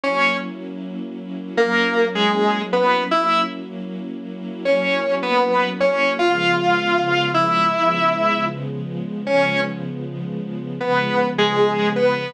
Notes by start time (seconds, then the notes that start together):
0.04 F#3 A#3 C#4 E4 C#5
1.57 F#3 A#3 C#4 E4 A#4
2.15 G#3 G#4
2.73 B3 B4
3.11 F#3 A#3 C#4 E4 E5
4.65 F#3 A#3 C#4 E4 C#5
5.23 B3 B4
5.80 C#4 C#5
6.19 C#3 F3 G#3 B3 F4 F5
7.34 E4 E5
7.73 C#3 F3 G#3 B3
9.27 C#3 F3 G#3 B3 C#4 C#5
10.80 C#3 F3 G#3 B3 B4
11.38 G#3 G#4
11.96 B3 B4